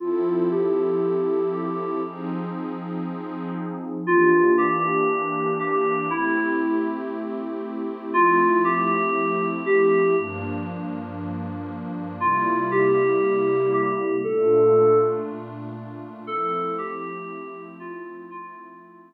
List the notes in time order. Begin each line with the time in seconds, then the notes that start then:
0.00 F3 C4 E4 F4 A4
0.51 G4
1.53 G4
2.03 F3 C4 D#4 G#4
4.07 E3 A#3 D4 F4 G4
4.58 G4
5.59 G4
6.10 A3 C4 E4 G4
8.14 F3 A3 C4 E4 F4
8.64 G4
9.66 G4
10.17 G2 F3 A#3 D4
12.20 C3 G3 A#3 E4 F4
12.71 G4
13.73 G4
14.24 A#2 A3 D4 F4 A4
16.27 F3 A3 C4 E4 A4
16.78 G4
17.80 F4
18.31 F3 A3 C4 E4 F4